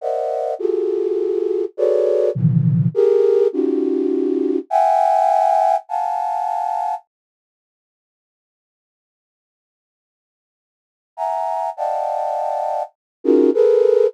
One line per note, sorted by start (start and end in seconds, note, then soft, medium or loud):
0.01 0.54 A#4 medium
0.01 0.54 C5 medium
0.01 0.54 D5 medium
0.01 0.54 D#5 medium
0.01 0.54 E5 medium
0.01 0.54 F#5 medium
0.59 1.65 F4 medium
0.59 1.65 F#4 medium
0.59 1.65 G4 medium
0.59 1.65 G#4 medium
0.59 1.65 A4 medium
1.77 2.30 F#4 medium
1.77 2.30 G#4 medium
1.77 2.30 A4 medium
1.77 2.30 B4 medium
1.77 2.30 C#5 medium
1.77 2.30 D5 medium
2.35 2.88 A#2 medium
2.35 2.88 C3 medium
2.35 2.88 D3 medium
2.35 2.88 D#3 medium
2.35 2.88 E3 medium
2.35 2.88 F3 medium
2.94 3.47 G4 loud
2.94 3.47 G#4 loud
2.94 3.47 A#4 loud
3.53 4.59 C#4 medium
3.53 4.59 D#4 medium
3.53 4.59 F4 medium
3.53 4.59 F#4 medium
3.53 4.59 G4 medium
4.70 5.76 E5 loud
4.70 5.76 F#5 loud
4.70 5.76 G5 loud
4.70 5.76 G#5 loud
5.89 6.95 F5 medium
5.89 6.95 F#5 medium
5.89 6.95 G#5 medium
5.89 6.95 A5 medium
11.17 11.70 E5 medium
11.17 11.70 F#5 medium
11.17 11.70 G#5 medium
11.17 11.70 A#5 medium
11.77 12.83 D5 medium
11.77 12.83 D#5 medium
11.77 12.83 F5 medium
11.77 12.83 F#5 medium
11.77 12.83 G5 medium
11.77 12.83 A5 medium
13.24 13.50 C#4 loud
13.24 13.50 D#4 loud
13.24 13.50 F4 loud
13.24 13.50 F#4 loud
13.24 13.50 G#4 loud
13.24 13.50 A#4 loud
13.54 14.07 G#4 loud
13.54 14.07 A4 loud
13.54 14.07 A#4 loud
13.54 14.07 B4 loud